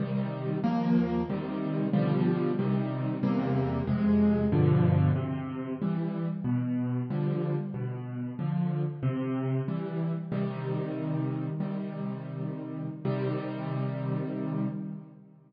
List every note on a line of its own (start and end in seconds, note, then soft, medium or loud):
0.00 0.58 C3 medium
0.00 0.58 D#3 medium
0.00 0.58 G3 medium
0.64 1.22 D#2 loud
0.64 1.22 F3 medium
0.64 1.22 A#3 loud
1.30 1.88 C3 medium
1.30 1.88 D#3 loud
1.30 1.88 G3 medium
1.93 2.51 B2 medium
1.93 2.51 D3 medium
1.93 2.51 F3 loud
1.93 2.51 G3 loud
2.59 3.17 C3 loud
2.59 3.17 D#3 medium
2.59 3.17 G3 medium
3.23 3.81 E2 loud
3.23 3.81 C3 loud
3.23 3.81 G3 medium
3.23 3.81 A#3 medium
3.87 4.45 F2 medium
3.87 4.45 C3 loud
3.87 4.45 G#3 medium
4.52 5.10 G2 loud
4.52 5.10 B2 medium
4.52 5.10 D3 loud
4.52 5.10 F3 loud
5.16 5.74 C3 loud
5.82 6.27 E3 medium
5.82 6.27 G3 medium
6.44 7.02 B2 loud
7.10 7.55 D3 medium
7.10 7.55 F3 medium
7.10 7.55 G3 medium
7.74 8.32 B2 medium
8.39 8.84 D3 medium
8.39 8.84 F3 medium
9.03 9.61 C3 loud
9.68 10.13 E3 medium
9.68 10.13 G3 medium
10.32 11.48 C3 medium
10.32 11.48 D#3 loud
10.32 11.48 G3 medium
11.60 12.88 C3 medium
11.60 12.88 D#3 medium
11.60 12.88 G3 medium
13.05 14.67 C3 loud
13.05 14.67 D#3 medium
13.05 14.67 G3 loud